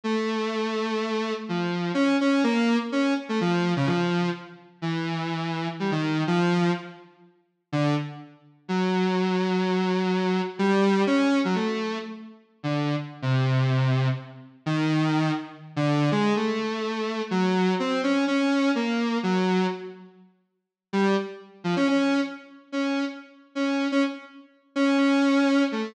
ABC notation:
X:1
M:6/4
L:1/16
Q:1/4=125
K:none
V:1 name="Lead 1 (square)"
A,12 F,4 _D2 D2 _B,3 z | _D2 z A, F,3 _D, F,4 z4 E,8 | G, _E,3 F,4 z8 D,2 z6 | _G,16 =G,4 _D3 _G, |
A,4 z5 D,3 z2 C,8 z2 | z2 _E,6 z3 D,3 _A,2 =A,8 | _G,4 C2 _D2 D4 _B,4 G,4 z4 | z6 G,2 z4 F, _D D3 z4 D3 |
z4 _D3 D z6 D2 D6 A,2 |]